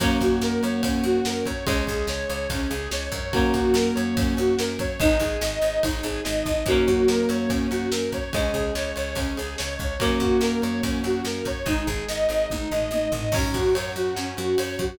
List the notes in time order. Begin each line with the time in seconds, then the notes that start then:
0.00 F#2 F#3 A#3 C#4 F#4, kick, ride
0.21 F#2 F#4, kick, ride
0.41 F#2 A#4, snare
0.63 F#2 C#5, ride
0.83 F#2 C#4, kick, ride
1.03 F#2 F#4, ride
1.25 F#2 A#4, snare
1.46 F#2 C#5, kick, ride
1.66 C#2 G#3 C#4, kick, ride
1.87 C#2 G#4, kick, ride
2.07 C#2 C#5, snare
2.30 C#2 C#5, ride
2.50 C#2 C#4, kick, ride
2.70 C#2 G#4, ride
2.91 C#2 C#5, snare
3.12 F#2 C#5, kick, ride
3.33 F#3 A#3 C#4, kick, ride
3.54 F#2 F#4, kick, ride
3.74 F#2 A#4, snare
3.95 F#2 C#5, ride
4.17 F#2 C#4, kick, ride
4.37 F#2 F#4, ride
4.59 F#2 A#4, snare
4.79 F#2 C#5, kick, ride
5.00 G#1 G#3 D#4, kick, ride
5.20 G#1 G#4, kick, ride
5.41 G#1 D#5, snare
5.61 G#1 D#5, ride
5.83 G#1 D#4, kick, ride
6.03 G#1 G#4, kick, ride
6.24 G#1 D#5, snare
6.45 G#1 D#5, kick, snare
6.66 F#2 F#3 A#3 C#4, kick, ride
6.70 A#3 C#4
6.87 F#2 F#4, kick, ride
7.08 F#2 A#4, snare
7.29 F#2 C#5, ride
7.49 F#2 C#4, kick, ride
7.70 F#2 F#4, ride
7.91 F#2 A#4, snare
8.12 F#2 C#5, kick, ride
8.32 C#2 G#3 C#4, kick, ride
8.36 C#4
8.53 C#2 G#4, kick, ride
8.75 C#2 C#5, snare
8.96 C#2 C#5, ride
9.15 C#2 C#4, kick, ride
9.36 C#2 G#4, ride
9.58 C#2 C#5, snare
9.79 C#2 C#5, kick, ride
10.00 F#2 F#3 A#3 C#4, kick, ride
10.20 F#2 F#4, kick, ride
10.41 F#2 A#4, snare
10.62 F#2 C#5, ride
10.83 F#2 C#4, kick, ride
11.04 F#2 F#4, ride
11.25 F#2 A#4, snare
11.45 F#2 C#5, kick, ride
11.66 G#1 G#3 D#4, kick, ride
11.87 G#1 G#4, kick, ride
12.08 G#1 D#5, snare
12.29 G#1 D#5, ride
12.50 G#1 D#4, kick, high tom
12.71 G#1 D#5, floor tom
12.91 G#1 D#5, high tom
13.12 G#1 D#5, floor tom
13.32 F#2 F#3 C#4 F#4, kick, crash
13.54 F#2 F#4, kick, ride
13.74 F#2 C#5, ride
13.96 F#2 F#4, ride
14.15 F#2 C#4, snare
14.37 F#2 F#4, ride
14.58 F#2 C#5, ride
14.79 F#2 F#4, kick, ride